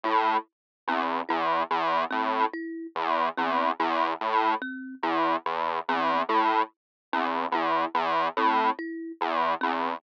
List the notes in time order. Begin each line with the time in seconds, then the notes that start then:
0.03 A2 E4
0.87 E2 C4
1.29 E2 E4
1.71 E2
2.11 A2 C4
2.53 E4
2.95 E2
3.37 E2 C4
3.80 E2 E4
4.21 A2
4.62 C4
5.03 E2 E4
5.46 E2
5.89 E2 C4
6.29 A2 E4
7.13 E2 C4
7.52 E2 E4
7.94 E2
8.37 A2 C4
8.79 E4
9.21 E2
9.61 E2 C4